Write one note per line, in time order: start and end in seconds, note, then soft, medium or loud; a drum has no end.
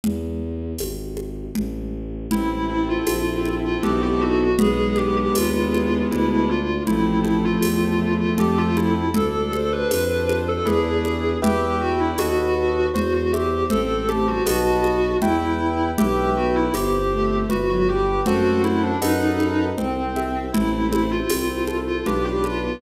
0.04 0.74 E2 medium
0.04 low conga loud
0.78 1.48 G#1 medium
0.78 tambourine medium
0.78 high conga medium
1.17 high conga medium
1.55 2.26 A1 medium
1.55 low conga medium
2.30 2.99 A1 medium
2.30 4.44 C4 medium
2.30 3.07 C4 medium
2.30 2.67 E4 medium
2.30 4.44 E4 medium
2.30 low conga loud
2.69 2.88 E4 medium
2.69 3.78 A4 medium
2.88 3.54 F4 medium
3.07 3.76 A#1 medium
3.07 3.80 C4 medium
3.07 tambourine medium
3.07 high conga medium
3.45 3.82 E4 medium
3.45 high conga medium
3.64 3.82 F4 medium
3.83 4.54 B1 medium
3.83 4.51 B3 loud
3.83 4.51 D#4 medium
3.83 4.51 F#4 loud
3.83 4.01 G4 medium
3.83 4.51 A4 medium
3.83 low conga medium
4.02 4.20 G4 medium
4.21 4.56 F#4 medium
4.59 5.28 B1 medium
4.59 6.51 G#3 medium
4.59 6.03 B3 loud
4.59 6.51 B3 loud
4.59 4.96 G#4 loud
4.59 low conga loud
4.96 6.05 D4 medium
4.96 5.15 G4 medium
4.96 high conga medium
5.17 5.35 G4 loud
5.34 6.03 D#2 medium
5.34 6.08 E4 medium
5.34 6.03 F4 medium
5.34 tambourine medium
5.34 high conga medium
5.72 6.09 G#4 medium
5.72 high conga medium
6.11 6.81 D2 loud
6.11 6.85 D4 medium
6.11 6.29 E4 medium
6.11 low conga medium
6.30 6.48 E4 medium
6.49 6.82 F4 medium
6.49 6.87 F4 medium
6.87 7.56 A1 medium
6.87 8.94 F3 medium
6.87 8.94 A3 medium
6.87 7.62 C4 medium
6.87 7.18 E4 loud
6.87 low conga medium
7.24 7.43 E4 medium
7.24 8.32 A4 medium
7.24 high conga medium
7.44 8.13 F4 medium
7.62 8.30 E2 medium
7.62 8.35 C4 medium
7.62 tambourine medium
7.62 high conga medium
8.02 8.38 E4 medium
8.20 8.38 F4 medium
8.38 9.09 F2 medium
8.38 9.06 C4 medium
8.38 9.06 F4 medium
8.38 8.57 G4 medium
8.38 9.06 A4 loud
8.38 low conga medium
8.58 8.76 F4 loud
8.77 9.13 E4 medium
8.77 high conga medium
9.14 9.84 D2 medium
9.14 9.91 D4 medium
9.14 9.47 A4 medium
9.14 9.52 A4 loud
9.14 low conga loud
9.52 10.60 A4 medium
9.52 9.70 A4 loud
9.52 10.58 C5 medium
9.52 high conga medium
9.72 10.37 B4 medium
9.91 10.59 F2 medium
9.91 10.63 D4 medium
9.91 tambourine medium
9.91 high conga medium
10.29 10.65 F4 medium
10.29 high conga medium
10.48 10.66 A4 medium
10.65 11.36 E2 loud
10.65 11.34 D4 loud
10.65 11.34 E4 medium
10.65 11.34 G#4 loud
10.65 11.37 G#4 medium
10.65 11.34 B4 medium
10.65 low conga medium
11.05 high conga medium
11.42 12.13 E2 medium
11.42 11.79 G4 medium
11.42 12.10 B4 medium
11.42 12.10 E5 medium
11.42 12.10 G5 medium
11.42 low conga loud
11.81 11.99 E4 medium
11.81 11.99 F#4 loud
12.00 12.18 D4 medium
12.00 12.18 E4 medium
12.18 12.88 D#2 medium
12.18 12.87 F#4 loud
12.18 12.87 A4 medium
12.18 12.87 B4 medium
12.18 12.87 D#5 medium
12.18 12.87 F#5 medium
12.18 tambourine medium
12.18 high conga medium
12.94 13.64 E2 medium
12.94 13.12 F#4 medium
12.94 13.66 C5 medium
12.94 low conga medium
13.14 13.32 F#4 medium
13.32 13.64 G4 medium
13.32 13.69 E5 medium
13.32 high conga medium
13.70 14.40 A1 medium
13.70 14.06 C4 loud
13.70 14.06 A4 loud
13.70 14.42 C5 medium
13.70 low conga medium
14.09 14.27 A3 medium
14.09 14.27 G4 medium
14.09 14.45 A5 medium
14.09 high conga medium
14.27 14.45 G3 medium
14.27 14.46 F#4 medium
14.46 15.16 B1 medium
14.46 15.15 F#4 loud
14.46 15.14 B4 medium
14.46 15.14 D#5 medium
14.46 15.14 F#5 medium
14.46 15.14 A5 medium
14.46 tambourine medium
14.46 high conga medium
14.84 high conga medium
15.22 15.92 E2 medium
15.22 15.89 E4 medium
15.22 15.90 B4 medium
15.22 15.90 E5 medium
15.22 15.90 G5 medium
15.22 low conga medium
15.98 16.69 B1 medium
15.98 16.29 G4 medium
15.98 16.68 B4 medium
15.98 16.68 E5 medium
15.98 16.68 G5 medium
15.98 low conga loud
16.36 16.67 B3 medium
16.36 16.55 F#4 medium
16.55 16.73 E4 loud
16.73 17.43 G1 medium
16.73 16.93 B3 medium
16.73 17.35 G4 loud
16.73 17.47 C5 medium
16.73 tambourine medium
16.73 high conga medium
16.93 17.11 C4 medium
17.12 17.45 A3 medium
17.12 17.49 E5 medium
17.49 18.20 G1 medium
17.49 17.69 F#4 medium
17.49 18.22 B4 medium
17.49 low conga medium
17.69 17.87 F#3 medium
17.69 17.87 F#4 loud
17.88 18.06 G3 medium
17.88 18.21 G4 medium
17.88 18.26 G5 medium
18.26 18.96 F#2 medium
18.26 18.88 A3 medium
18.26 18.88 C4 medium
18.26 18.60 F#4 loud
18.26 18.95 A4 medium
18.26 18.95 C5 medium
18.26 18.95 F#5 medium
18.26 low conga medium
18.64 18.82 E4 medium
18.64 high conga medium
18.83 19.01 D4 medium
19.01 19.72 F#2 medium
19.01 19.65 D#4 medium
19.01 19.70 A4 medium
19.01 19.70 B4 medium
19.01 19.70 D#5 medium
19.01 19.70 F#5 loud
19.01 tambourine medium
19.01 high conga medium
19.40 high conga medium
19.78 20.49 C2 medium
19.78 20.45 C4 medium
19.78 20.50 C5 medium
19.78 low conga medium
20.16 20.52 E5 medium
20.16 high conga medium
20.52 21.22 A1 medium
20.52 21.16 A3 medium
20.52 21.16 C4 medium
20.52 21.29 E4 medium
20.52 20.87 E4 loud
20.52 low conga loud
20.91 21.10 E4 loud
20.91 22.00 C5 medium
20.91 high conga medium
21.11 21.77 F4 medium
21.29 22.00 C2 medium
21.29 21.47 C4 medium
21.29 22.02 E4 medium
21.29 tambourine medium
21.29 high conga medium
21.49 21.67 C4 medium
21.67 22.03 A4 medium
21.67 high conga medium
21.87 22.05 F4 medium
22.05 22.75 B1 medium
22.05 22.75 D4 loud
22.05 22.75 F4 medium
22.05 22.24 G4 medium
22.05 22.75 B4 medium
22.05 low conga medium
22.25 22.43 G4 loud
22.44 22.77 F4 loud
22.44 high conga medium
22.63 22.81 B3 medium